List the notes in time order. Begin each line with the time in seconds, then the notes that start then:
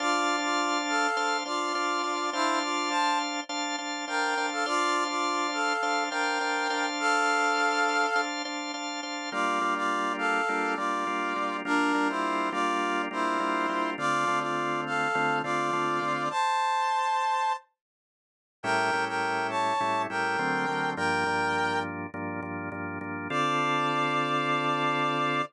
0.00 D4 F4 C5 D5 F5 A5
0.43 F4 D5
0.89 A4 F5
1.17 D4 C5 F5 A5
1.46 D4 F4 C5 D5 F5 A5
1.75 D4 C5 F5 A5
2.04 D4 C5 F5 A5
2.33 D4 E4 C5 F5 A5
2.62 F4 D5
2.90 C5 A5
3.49 D4 C5 F5 A5
3.78 D4 C5 F5 A5
4.08 D4 A#4 C5 F5 G5 A5
4.37 D4 C5 F5 A5
4.52 A4 F5
4.66 D4 F4 C5 D5 F5 A5
5.09 F4 D5
5.53 A4 F5
5.83 D4 C5 F5 A5
6.10 D4 A#4 C5 F5 G5 A5
6.41 D4 C5 F5 A5
6.70 D4 C5 F5 A5
7.00 A4 F5
8.16 D4 C5 F5 A5
8.45 D4 C5 F5 A5
8.74 D4 C5 F5 A5
9.03 D4 C5 F5 A5
9.32 G3 A#3 D4 F4 D5
9.61 G3 A#3 D4 F4
9.76 F4 D5
10.18 A4 F5
10.49 G3 A#3 D4 F4
10.76 G3 A#3 D4 F4 D5
11.07 G3 A#3 D4 F4
11.36 G3 A#3 D4 F4
11.65 G3 A#3 D4 F4 A#4
11.94 G3 A#3 D4 F4
12.09 E4 C5
12.52 G3 A#3 D4 F4 D5
13.11 G3 A#3 D4 E4 F4 C5
13.40 G3 A#3 D4 F4
13.69 G3 A#3 D4 F4
13.98 D3 A3 C4 F4 D5
14.28 D3 A3 C4 F4
14.40 F4 D5
14.86 A4 F5
15.15 D3 A3 C4 F4
15.43 D3 A3 C4 F4 D5
15.73 D3 A3 C4 F4
16.02 D3 A3 C4 F4
16.30 C5 A5
18.63 A2 G3 C#4 E4 A#4 G5
18.93 A2 G3 C#4 E4
19.08 A#4 G5
19.50 C#5 A5
19.80 A2 G3 C#4 E4
20.10 A2 G3 C#4 E4 A#4 G5
20.39 D3 F#3 A3 C4
20.68 D3 F#3 A3 C4
20.96 G2 F3 A#3 D4 A#4 G5
21.26 G2 F3 A#3 D4
22.14 G2 F3 A#3 D4
22.42 G2 F3 A#3 D4
22.72 G2 F3 A#3 D4
23.01 G2 F3 A#3 D4
23.30 D3 C4 F4 A4 D5